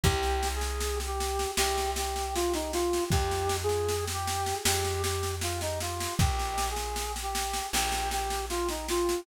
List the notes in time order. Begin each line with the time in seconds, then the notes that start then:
0.04 C2 G4, kick, snare
0.23 snare
0.43 snare
0.55 G#4
0.61 snare
0.80 snare
1.00 snare
1.07 G4
1.20 snare
1.39 snare
1.57 C2 G4, snare
1.78 snare
1.96 G4, snare
2.16 snare
2.35 F4, snare
2.54 D#4, snare
2.73 F4, snare
2.93 snare
3.10 F2 G4, kick, snare
3.31 snare
3.49 snare
3.63 G#4
3.69 snare
3.88 snare
4.08 snare
4.13 G4
4.27 snare
4.46 snare
4.65 F2 G4, snare
4.84 snare
5.03 G4, snare
5.23 snare
5.41 F4, snare
5.61 D#4, snare
5.80 F4, snare
6.00 snare
6.19 A#1 G4, kick, snare
6.39 snare
6.58 snare
6.70 G#4
6.76 snare
6.96 snare
7.16 snare
7.22 G4
7.35 snare
7.54 snare
7.73 A#1 G4, snare
7.92 snare
8.11 G4, snare
8.30 snare
8.50 F4, snare
8.69 D#4, snare
8.88 F4, snare
9.09 snare